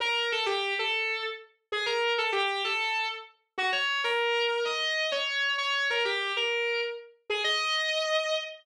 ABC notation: X:1
M:4/4
L:1/8
Q:"Swing" 1/4=129
K:Eb
V:1 name="Distortion Guitar"
B =A G A2 z2 _A | B =A G A2 z2 _G | _d B3 e2 d2 | _d B G B2 z2 A |
e4 z4 |]